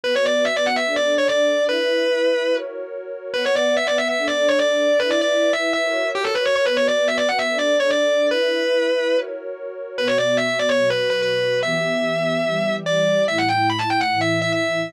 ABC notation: X:1
M:4/4
L:1/16
Q:1/4=145
K:Bm
V:1 name="Distortion Guitar"
B c d2 e d f e2 d2 c d4 | B10 z6 | B c d2 e d e e2 d2 c d4 | B d d3 e2 e4 G A B c c |
B c d2 e d f e2 d2 c d4 | B10 z6 | B c d2 e e d c2 B2 B B4 | e12 d4 |
e f g2 b a g f2 e2 e e4 |]
V:2 name="Pad 2 (warm)"
[B,FB]8 [DAd]8 | [EBe]8 [F^Ac]8 | [B,Bf]8 [DAd]8 | [EBe]8 [F^Ac]8 |
[B,FB]8 [DAd]8 | [EBe]8 [F^Ac]8 | [B,,B,F]8 [B,,F,F]8 | [E,B,G]8 [E,G,G]8 |
[A,,A,E]8 [A,,E,E]8 |]